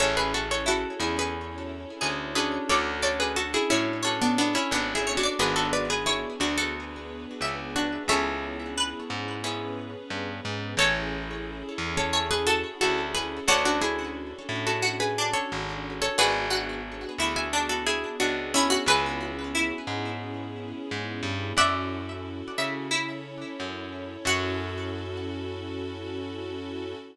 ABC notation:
X:1
M:4/4
L:1/16
Q:1/4=89
K:F#m
V:1 name="Acoustic Guitar (steel)"
[Ac] [GB] [FA] [Ac] [FA]2 [EG] [GB]7 [GB]2 | [Ac]2 [Ac] [GB] [FA] [EG] [CE]3 [B,D] [B,D] [CE] (3[B,D]2 [EG]2 [DF]2 | [GB] [FA] [Bd] [GB] [EG]2 [DF] [FA]7 [DF]2 | [Ac]6 z10 |
[Ac]6 z [Ac]2 [GB] [FA]2 [FA]2 [GB]2 | [Ac] [DF] [EG]5 [FA]2 [GB]2 [Ac]4 [Ac] | [GB]6 z [eg]2 [FA] [EG]2 [DF]2 [CE]2 | [GB]6 z10 |
[df]8 z8 | f16 |]
V:2 name="Harpsichord"
z4 E8 G4 | d2 d4 c2 c6 c d | z4 c8 e4 | e4 B6 z6 |
c8 c2 A6 | F8 F2 D6 | F2 F4 E2 D6 E F | B4 E6 z6 |
e3 z3 e2 E8 | F16 |]
V:3 name="Acoustic Guitar (steel)"
[CEGA]14 [CDFA]2- | [CDFA]8 [CDFA]8 | [B,DFG]16 | [B,CEG]8 [B,CEG]8 |
[cega]8 [cega]8 | [cdfa]16 | [Bdfg]16 | [Bceg]16 |
z16 | z16 |]
V:4 name="Electric Bass (finger)" clef=bass
A,,,6 E,,6 D,,4 | D,,6 A,,6 G,,,4 | G,,,6 D,,6 C,,4 | C,,6 G,,6 =G,,2 ^G,,2 |
A,,,6 E,,6 D,,4 | D,,6 A,,6 G,,,4 | G,,,6 D,,6 C,,4 | C,,6 G,,6 G,,2 =G,,2 |
F,,6 C,6 F,,4 | F,,16 |]
V:5 name="String Ensemble 1"
[CEGA]8 [CEAc]8 | [CDFA]8 [CDAc]8 | [B,DFG]8 [B,DGB]8 | [B,CEG]8 [B,CGB]8 |
[CEGA]16 | [CDFA]16 | [B,DFG]16 | [B,CEG]16 |
[CEFA]8 [CEAc]8 | [CEFA]16 |]